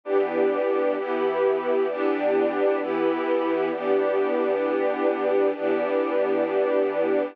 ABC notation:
X:1
M:4/4
L:1/8
Q:1/4=131
K:Em
V:1 name="String Ensemble 1"
[E,B,DG]4 [E,B,EG]4 | [E,B,DG]4 [E,B,EG]4 | [E,B,DG]8 | [E,B,DG]8 |]